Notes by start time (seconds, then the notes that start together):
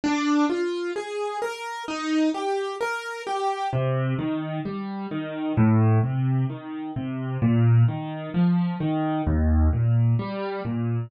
0.04 D4
0.50 F4
0.96 G#4
1.42 A#4
1.88 D#4
2.34 G4
2.81 A#4
3.27 G4
3.73 C3
4.19 D#3
4.65 G3
5.11 D#3
5.57 A2
6.03 C3
6.50 D#3
6.96 C3
7.42 A#2
7.88 D#3
8.34 F3
8.80 D#3
9.27 D#2
9.73 A#2
10.19 G3
10.65 A#2